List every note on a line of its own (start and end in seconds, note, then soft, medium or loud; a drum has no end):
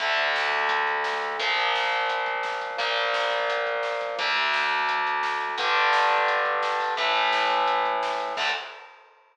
0.00 1.37 D2 medium
0.00 1.37 D3 medium
0.00 1.37 A3 medium
0.00 kick medium
0.00 closed hi-hat medium
0.09 kick medium
0.17 kick medium
0.17 closed hi-hat medium
0.27 kick medium
0.35 kick medium
0.35 snare loud
0.44 kick medium
0.51 kick medium
0.51 closed hi-hat medium
0.61 kick medium
0.69 kick loud
0.69 closed hi-hat loud
0.78 kick medium
0.87 kick medium
0.87 closed hi-hat medium
0.97 kick medium
1.04 kick medium
1.04 snare loud
1.13 kick medium
1.22 kick medium
1.22 closed hi-hat medium
1.31 kick medium
1.39 2.76 A#2 medium
1.39 2.76 F3 medium
1.39 2.76 A#3 medium
1.39 kick medium
1.39 closed hi-hat medium
1.49 kick medium
1.57 kick medium
1.57 closed hi-hat medium
1.65 kick medium
1.74 kick medium
1.74 snare medium
1.84 kick medium
1.92 kick medium
1.92 closed hi-hat medium
2.00 kick medium
2.09 kick medium
2.09 closed hi-hat medium
2.18 kick medium
2.26 kick medium
2.26 closed hi-hat medium
2.35 kick medium
2.43 kick medium
2.43 snare medium
2.52 kick medium
2.61 kick medium
2.61 closed hi-hat medium
2.70 kick medium
2.78 4.15 A#2 medium
2.78 4.15 F3 medium
2.78 4.15 A#3 medium
2.78 kick loud
2.78 closed hi-hat medium
2.88 kick medium
2.97 kick medium
2.97 closed hi-hat medium
3.05 kick medium
3.14 kick medium
3.14 snare loud
3.23 kick medium
3.31 kick medium
3.31 closed hi-hat medium
3.40 kick medium
3.49 kick medium
3.49 closed hi-hat loud
3.57 kick medium
3.66 kick medium
3.66 closed hi-hat medium
3.75 kick medium
3.83 kick medium
3.83 snare medium
3.92 kick medium
4.01 kick medium
4.01 closed hi-hat medium
4.09 kick medium
4.19 5.56 D2 medium
4.19 5.56 D3 medium
4.19 5.56 A3 medium
4.19 kick loud
4.19 closed hi-hat medium
4.27 kick medium
4.36 kick medium
4.36 closed hi-hat medium
4.45 kick medium
4.53 kick medium
4.53 snare medium
4.62 kick medium
4.70 kick medium
4.70 closed hi-hat medium
4.80 kick medium
4.89 kick medium
4.89 closed hi-hat medium
4.98 kick medium
5.07 kick medium
5.07 closed hi-hat medium
5.15 kick medium
5.23 kick medium
5.23 snare medium
5.32 kick medium
5.40 kick medium
5.40 closed hi-hat medium
5.49 kick medium
5.58 6.94 G2 medium
5.58 6.94 D3 medium
5.58 6.94 G3 medium
5.58 kick loud
5.58 closed hi-hat loud
5.66 kick medium
5.75 kick medium
5.75 closed hi-hat medium
5.84 kick medium
5.93 kick medium
5.93 snare loud
6.01 kick medium
6.11 kick medium
6.11 closed hi-hat medium
6.19 kick medium
6.28 kick medium
6.28 closed hi-hat medium
6.37 kick medium
6.45 kick medium
6.45 closed hi-hat medium
6.55 kick medium
6.63 kick medium
6.63 snare medium
6.72 kick medium
6.80 kick medium
6.80 open hi-hat medium
6.89 kick medium
6.97 8.34 A2 medium
6.97 8.34 E3 medium
6.97 8.34 A3 medium
6.97 kick medium
6.97 closed hi-hat medium
7.06 kick medium
7.15 kick medium
7.15 closed hi-hat medium
7.24 kick medium
7.33 kick medium
7.33 snare loud
7.41 kick medium
7.50 kick medium
7.50 closed hi-hat medium
7.58 kick medium
7.68 kick medium
7.68 closed hi-hat medium
7.76 kick medium
7.85 kick medium
7.85 closed hi-hat medium
7.94 kick medium
8.03 kick medium
8.03 snare loud
8.12 kick medium
8.19 kick medium
8.19 closed hi-hat medium
8.28 kick medium
8.37 8.49 D2 loud
8.37 8.49 D3 loud
8.37 8.49 A3 loud
8.37 kick loud
8.37 crash loud